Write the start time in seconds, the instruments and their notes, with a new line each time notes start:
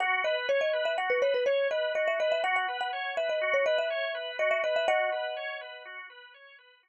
0.00 drawbar organ F#4, marimba F#5
0.24 drawbar organ B4, marimba D#5
0.49 drawbar organ C#5, marimba C#5
0.61 marimba D#5
0.73 drawbar organ B4
0.85 marimba E5
0.98 drawbar organ F#4, marimba F#5
1.10 marimba B4
1.22 drawbar organ B4, marimba C#5
1.34 marimba B4
1.46 marimba C#5, drawbar organ C#5
1.71 drawbar organ B4, marimba D#5
1.95 drawbar organ F#4, marimba D#5
2.08 marimba E5
2.19 drawbar organ B4, marimba D#5
2.32 marimba E5
2.44 drawbar organ F#4, marimba F#5
2.56 marimba F#5
2.68 drawbar organ B4
2.81 marimba F#5
2.93 drawbar organ C#5
3.17 drawbar organ B4, marimba E5
3.29 marimba D#5
3.41 drawbar organ F#4
3.54 marimba C#5
3.66 drawbar organ B4, marimba D#5
3.78 marimba E5
3.90 drawbar organ C#5
4.15 drawbar organ B4
4.39 drawbar organ F#4, marimba D#5
4.51 marimba E5
4.63 drawbar organ B4, marimba D#5
4.76 marimba E5
4.88 drawbar organ F#4, marimba D#5 F#5
5.12 drawbar organ B4
5.37 drawbar organ C#5
5.61 drawbar organ B4
5.85 drawbar organ F#4
6.10 drawbar organ B4
6.34 drawbar organ C#5
6.59 drawbar organ B4
6.83 drawbar organ F#4